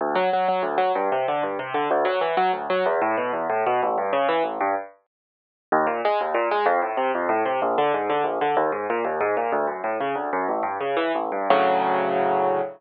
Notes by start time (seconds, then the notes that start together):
0.01 D2
0.15 F#3
0.33 F#3
0.48 F#3
0.63 D2
0.78 F#3
0.95 G2
1.12 C3
1.28 D3
1.43 G2
1.59 C3
1.74 D3
1.91 D2
2.05 F#3
2.21 E3
2.37 F#3
2.53 D2
2.70 F#3
2.86 E2
3.01 A2
3.17 B2
3.33 E2
3.50 A2
3.67 B2
3.83 A1
3.98 G2
4.13 C#3
4.29 E3
4.44 A1
4.61 G2
5.72 D#2
5.87 A#2
6.05 G#3
6.21 D#2
6.34 A#2
6.51 G#3
6.66 F2
6.82 A2
6.97 C3
7.15 F2
7.29 A2
7.46 C3
7.62 A#1
7.78 D3
7.94 G#2
8.10 D3
8.24 A#1
8.41 D3
8.57 D#2
8.72 G#2
8.90 A#2
9.05 D#2
9.21 G#2
9.37 A#2
9.52 D2
9.67 F#2
9.84 A2
10.00 C#3
10.15 D2
10.33 F#2
10.48 A1
10.63 G2
10.81 C#3
10.97 E3
11.15 A1
11.32 G2
11.50 D2 A2 C#3 F#3